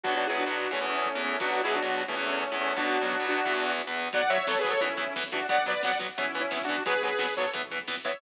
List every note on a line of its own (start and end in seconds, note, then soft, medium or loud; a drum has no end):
0.03 0.25 B2 loud
0.03 0.25 F#3 loud
0.03 0.25 B3 loud
0.03 0.14 D4 medium
0.03 0.14 F#4 medium
0.03 kick loud
0.16 0.27 D4 medium
0.16 0.27 F#4 medium
0.27 0.43 B2 medium
0.27 0.43 F#3 medium
0.27 0.43 B3 medium
0.27 0.37 E4 medium
0.27 0.37 G#4 medium
0.38 0.71 D4 medium
0.38 0.71 F#4 medium
0.38 kick medium
0.46 0.67 B2 medium
0.46 0.67 F#3 medium
0.46 0.67 B3 medium
0.71 0.78 E2 loud
0.71 0.78 E3 loud
0.71 0.87 A3 medium
0.71 0.78 B3 medium
0.71 0.87 C#4 medium
0.71 kick medium
0.81 1.08 E2 medium
0.81 1.08 E3 medium
0.81 1.08 B3 medium
0.89 1.22 A3 medium
0.89 1.22 C#4 medium
1.06 kick medium
1.15 1.36 E2 medium
1.15 1.36 E3 medium
1.15 1.36 B3 medium
1.24 1.39 A3 medium
1.24 1.39 C#4 medium
1.40 1.61 B2 medium
1.40 1.61 F#3 loud
1.40 1.61 B3 medium
1.40 1.51 D4 medium
1.40 1.51 F#4 medium
1.40 kick loud
1.51 1.62 D4 medium
1.51 1.62 F#4 medium
1.63 1.79 B2 medium
1.63 1.79 F#3 medium
1.63 1.79 B3 medium
1.63 1.74 E4 medium
1.63 1.74 G#4 medium
1.74 2.02 D4 medium
1.74 2.02 F#4 medium
1.74 kick medium
1.82 2.03 B2 medium
1.82 2.03 F#3 medium
1.82 2.03 B3 medium
2.08 2.15 E2 loud
2.08 2.15 E3 loud
2.08 2.24 A3 medium
2.08 2.15 B3 loud
2.08 2.24 C#4 medium
2.08 kick medium
2.16 2.44 E2 medium
2.16 2.44 E3 medium
2.16 2.44 B3 medium
2.26 2.56 A3 medium
2.26 2.56 C#4 medium
2.43 kick medium
2.52 2.72 E2 medium
2.52 2.72 E3 medium
2.52 2.72 B3 medium
2.61 2.76 A3 medium
2.61 2.76 C#4 medium
2.76 2.97 B2 medium
2.76 2.97 F#3 medium
2.76 2.97 B3 loud
2.76 3.26 D4 medium
2.76 3.26 F#4 medium
2.76 kick loud
3.01 3.15 B2 medium
3.01 3.15 F#3 medium
3.01 3.15 B3 medium
3.12 kick loud
3.20 3.40 B2 medium
3.20 3.40 F#3 medium
3.20 3.40 B3 medium
3.28 3.72 D4 medium
3.28 3.72 F#4 medium
3.46 3.52 E2 medium
3.46 3.52 E3 loud
3.46 3.52 B3 medium
3.46 kick medium
3.54 3.81 E2 medium
3.54 3.81 E3 medium
3.54 3.81 B3 medium
3.79 kick medium
3.87 4.08 E2 medium
3.87 4.08 E3 medium
3.87 4.08 B3 medium
4.13 4.42 B1 loud
4.13 4.21 F#3 medium
4.13 4.21 B3 medium
4.13 4.30 D5 medium
4.13 4.30 F#5 medium
4.13 kick loud
4.13 closed hi-hat loud
4.23 kick loud
4.30 4.37 F#3 medium
4.30 4.37 B3 medium
4.30 4.46 C#5 medium
4.30 4.46 E5 medium
4.30 kick medium
4.30 closed hi-hat medium
4.38 kick loud
4.47 4.77 B1 loud
4.47 4.54 F#3 medium
4.47 4.54 B3 medium
4.47 4.58 A4 medium
4.47 4.58 C#5 medium
4.47 kick loud
4.47 snare loud
4.55 4.69 G#4 medium
4.55 4.69 B4 medium
4.55 kick medium
4.64 4.72 F#3 medium
4.64 4.72 B3 medium
4.64 kick loud
4.64 closed hi-hat medium
4.70 4.81 A4 medium
4.70 4.81 C#5 medium
4.70 kick loud
4.81 5.10 B1 loud
4.81 4.88 E3 medium
4.81 4.88 B3 medium
4.81 5.14 C#4 medium
4.81 5.14 E4 medium
4.81 kick loud
4.81 closed hi-hat loud
4.89 kick medium
4.97 5.04 E3 medium
4.97 5.04 B3 medium
4.97 kick medium
4.97 closed hi-hat medium
5.07 kick medium
5.15 5.44 B1 loud
5.15 5.23 E3 medium
5.15 5.23 B3 medium
5.15 kick loud
5.15 snare loud
5.24 kick medium
5.32 5.39 E3 medium
5.32 5.39 B3 medium
5.32 5.47 D4 medium
5.32 5.47 F#4 medium
5.32 kick loud
5.32 closed hi-hat loud
5.41 kick medium
5.49 5.78 B1 loud
5.49 5.56 F#3 medium
5.49 5.56 B3 medium
5.49 5.64 D5 medium
5.49 5.64 F#5 medium
5.49 kick loud
5.49 closed hi-hat loud
5.58 kick loud
5.66 5.73 F#3 medium
5.66 5.73 B3 medium
5.66 5.82 B4 medium
5.66 5.82 D5 medium
5.66 kick medium
5.66 closed hi-hat medium
5.75 kick medium
5.83 6.12 B1 medium
5.83 5.91 F#3 medium
5.83 5.91 B3 medium
5.83 5.98 D5 medium
5.83 5.98 F#5 medium
5.83 kick loud
5.83 snare loud
5.92 kick medium
5.99 6.06 F#3 medium
5.99 6.06 B3 medium
5.99 kick loud
5.99 closed hi-hat medium
6.09 kick medium
6.18 6.47 B1 loud
6.18 6.25 E3 medium
6.18 6.25 B3 medium
6.18 6.40 C#4 medium
6.18 6.40 E4 medium
6.18 kick loud
6.18 closed hi-hat loud
6.26 kick medium
6.35 6.42 E3 medium
6.35 6.42 B3 medium
6.35 kick medium
6.35 closed hi-hat medium
6.41 6.62 C#4 medium
6.41 6.62 E4 medium
6.41 kick medium
6.51 6.80 B1 medium
6.51 6.58 E3 medium
6.51 6.58 B3 medium
6.51 kick loud
6.51 snare loud
6.61 6.83 D4 medium
6.61 6.83 F#4 medium
6.61 kick medium
6.68 6.76 E3 medium
6.68 6.76 B3 medium
6.68 kick medium
6.68 closed hi-hat medium
6.78 kick medium
6.86 7.15 B1 loud
6.86 6.93 F#3 medium
6.86 6.93 B3 medium
6.86 7.02 G#4 medium
6.86 7.02 B4 medium
6.86 kick loud
6.86 closed hi-hat loud
6.95 kick medium
7.03 7.10 F#3 medium
7.03 7.10 B3 medium
7.03 7.34 G#4 medium
7.03 7.34 B4 medium
7.03 kick medium
7.03 closed hi-hat medium
7.12 kick medium
7.19 7.49 B1 medium
7.19 7.26 F#3 medium
7.19 7.26 B3 medium
7.19 kick medium
7.19 snare loud
7.27 kick medium
7.37 7.45 F#3 medium
7.37 7.45 B3 medium
7.37 7.51 A4 medium
7.37 7.51 C#5 medium
7.37 kick medium
7.37 closed hi-hat medium
7.45 kick medium
7.54 7.84 B1 loud
7.54 7.61 E3 medium
7.54 7.61 B3 medium
7.54 kick loud
7.54 closed hi-hat loud
7.63 kick medium
7.71 7.78 E3 medium
7.71 7.78 B3 medium
7.71 kick medium
7.71 closed hi-hat medium
7.79 kick loud
7.88 8.17 B1 medium
7.88 7.95 E3 medium
7.88 7.95 B3 medium
7.88 kick loud
7.88 snare loud
7.97 kick medium
8.05 8.12 E3 medium
8.05 8.12 B3 medium
8.05 8.19 C#5 medium
8.05 8.19 E5 medium
8.05 kick loud
8.05 closed hi-hat medium
8.13 kick loud